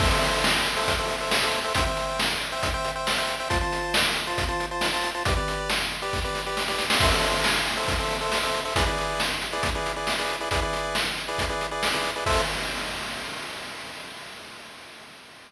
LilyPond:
<<
  \new Staff \with { instrumentName = "Lead 1 (square)" } { \time 4/4 \key a \minor \tempo 4 = 137 <a' c'' e''>16 <a' c'' e''>4. <a' c'' e''>8 <a' c'' e''>8 <a' c'' e''>8 <a' c'' e''>8 <a' c'' e''>16 | <c'' e'' g''>16 <c'' e'' g''>4. <c'' e'' g''>8 <c'' e'' g''>8 <c'' e'' g''>8 <c'' e'' g''>8 <c'' e'' g''>16 | <f' c'' a''>16 <f' c'' a''>4. <f' c'' a''>8 <f' c'' a''>8 <f' c'' a''>8 <f' c'' a''>8 <f' c'' a''>16 | <g' b' d''>16 <g' b' d''>4. <g' b' d''>8 <g' b' d''>8 <g' b' d''>8 <g' b' d''>8 <g' b' d''>16 |
<a' c'' e''>16 <a' c'' e''>4. <a' c'' e''>8 <a' c'' e''>8 <a' c'' e''>8 <a' c'' e''>8 <a' c'' e''>16 | <e' gis' b' d''>16 <e' gis' b' d''>4. <e' gis' b' d''>8 <e' gis' b' d''>8 <e' gis' b' d''>8 <e' gis' b' d''>8 <e' gis' b' d''>16 | <e' gis' b' d''>16 <e' gis' b' d''>4. <e' gis' b' d''>8 <e' gis' b' d''>8 <e' gis' b' d''>8 <e' gis' b' d''>8 <e' gis' b' d''>16 | <a' c'' e''>4 r2. | }
  \new DrumStaff \with { instrumentName = "Drums" } \drummode { \time 4/4 <cymc bd>8 hh8 sn8 hh8 <hh bd>8 hh8 sn8 hh8 | <hh bd>8 hh8 sn8 hh8 <hh bd>8 hh8 sn8 hh8 | <hh bd>8 hh8 sn8 hh8 <hh bd>8 hh8 sn8 hh8 | <hh bd>8 hh8 sn8 hh8 <bd sn>8 sn8 sn16 sn16 sn16 sn16 |
<cymc bd>8 hh8 sn8 hh8 <hh bd>8 hh8 sn8 hh8 | <hh bd>8 hh8 sn8 hh8 <hh bd>8 hh8 sn8 hh8 | <hh bd>8 hh8 sn8 hh8 <hh bd>8 hh8 sn8 hh8 | <cymc bd>4 r4 r4 r4 | }
>>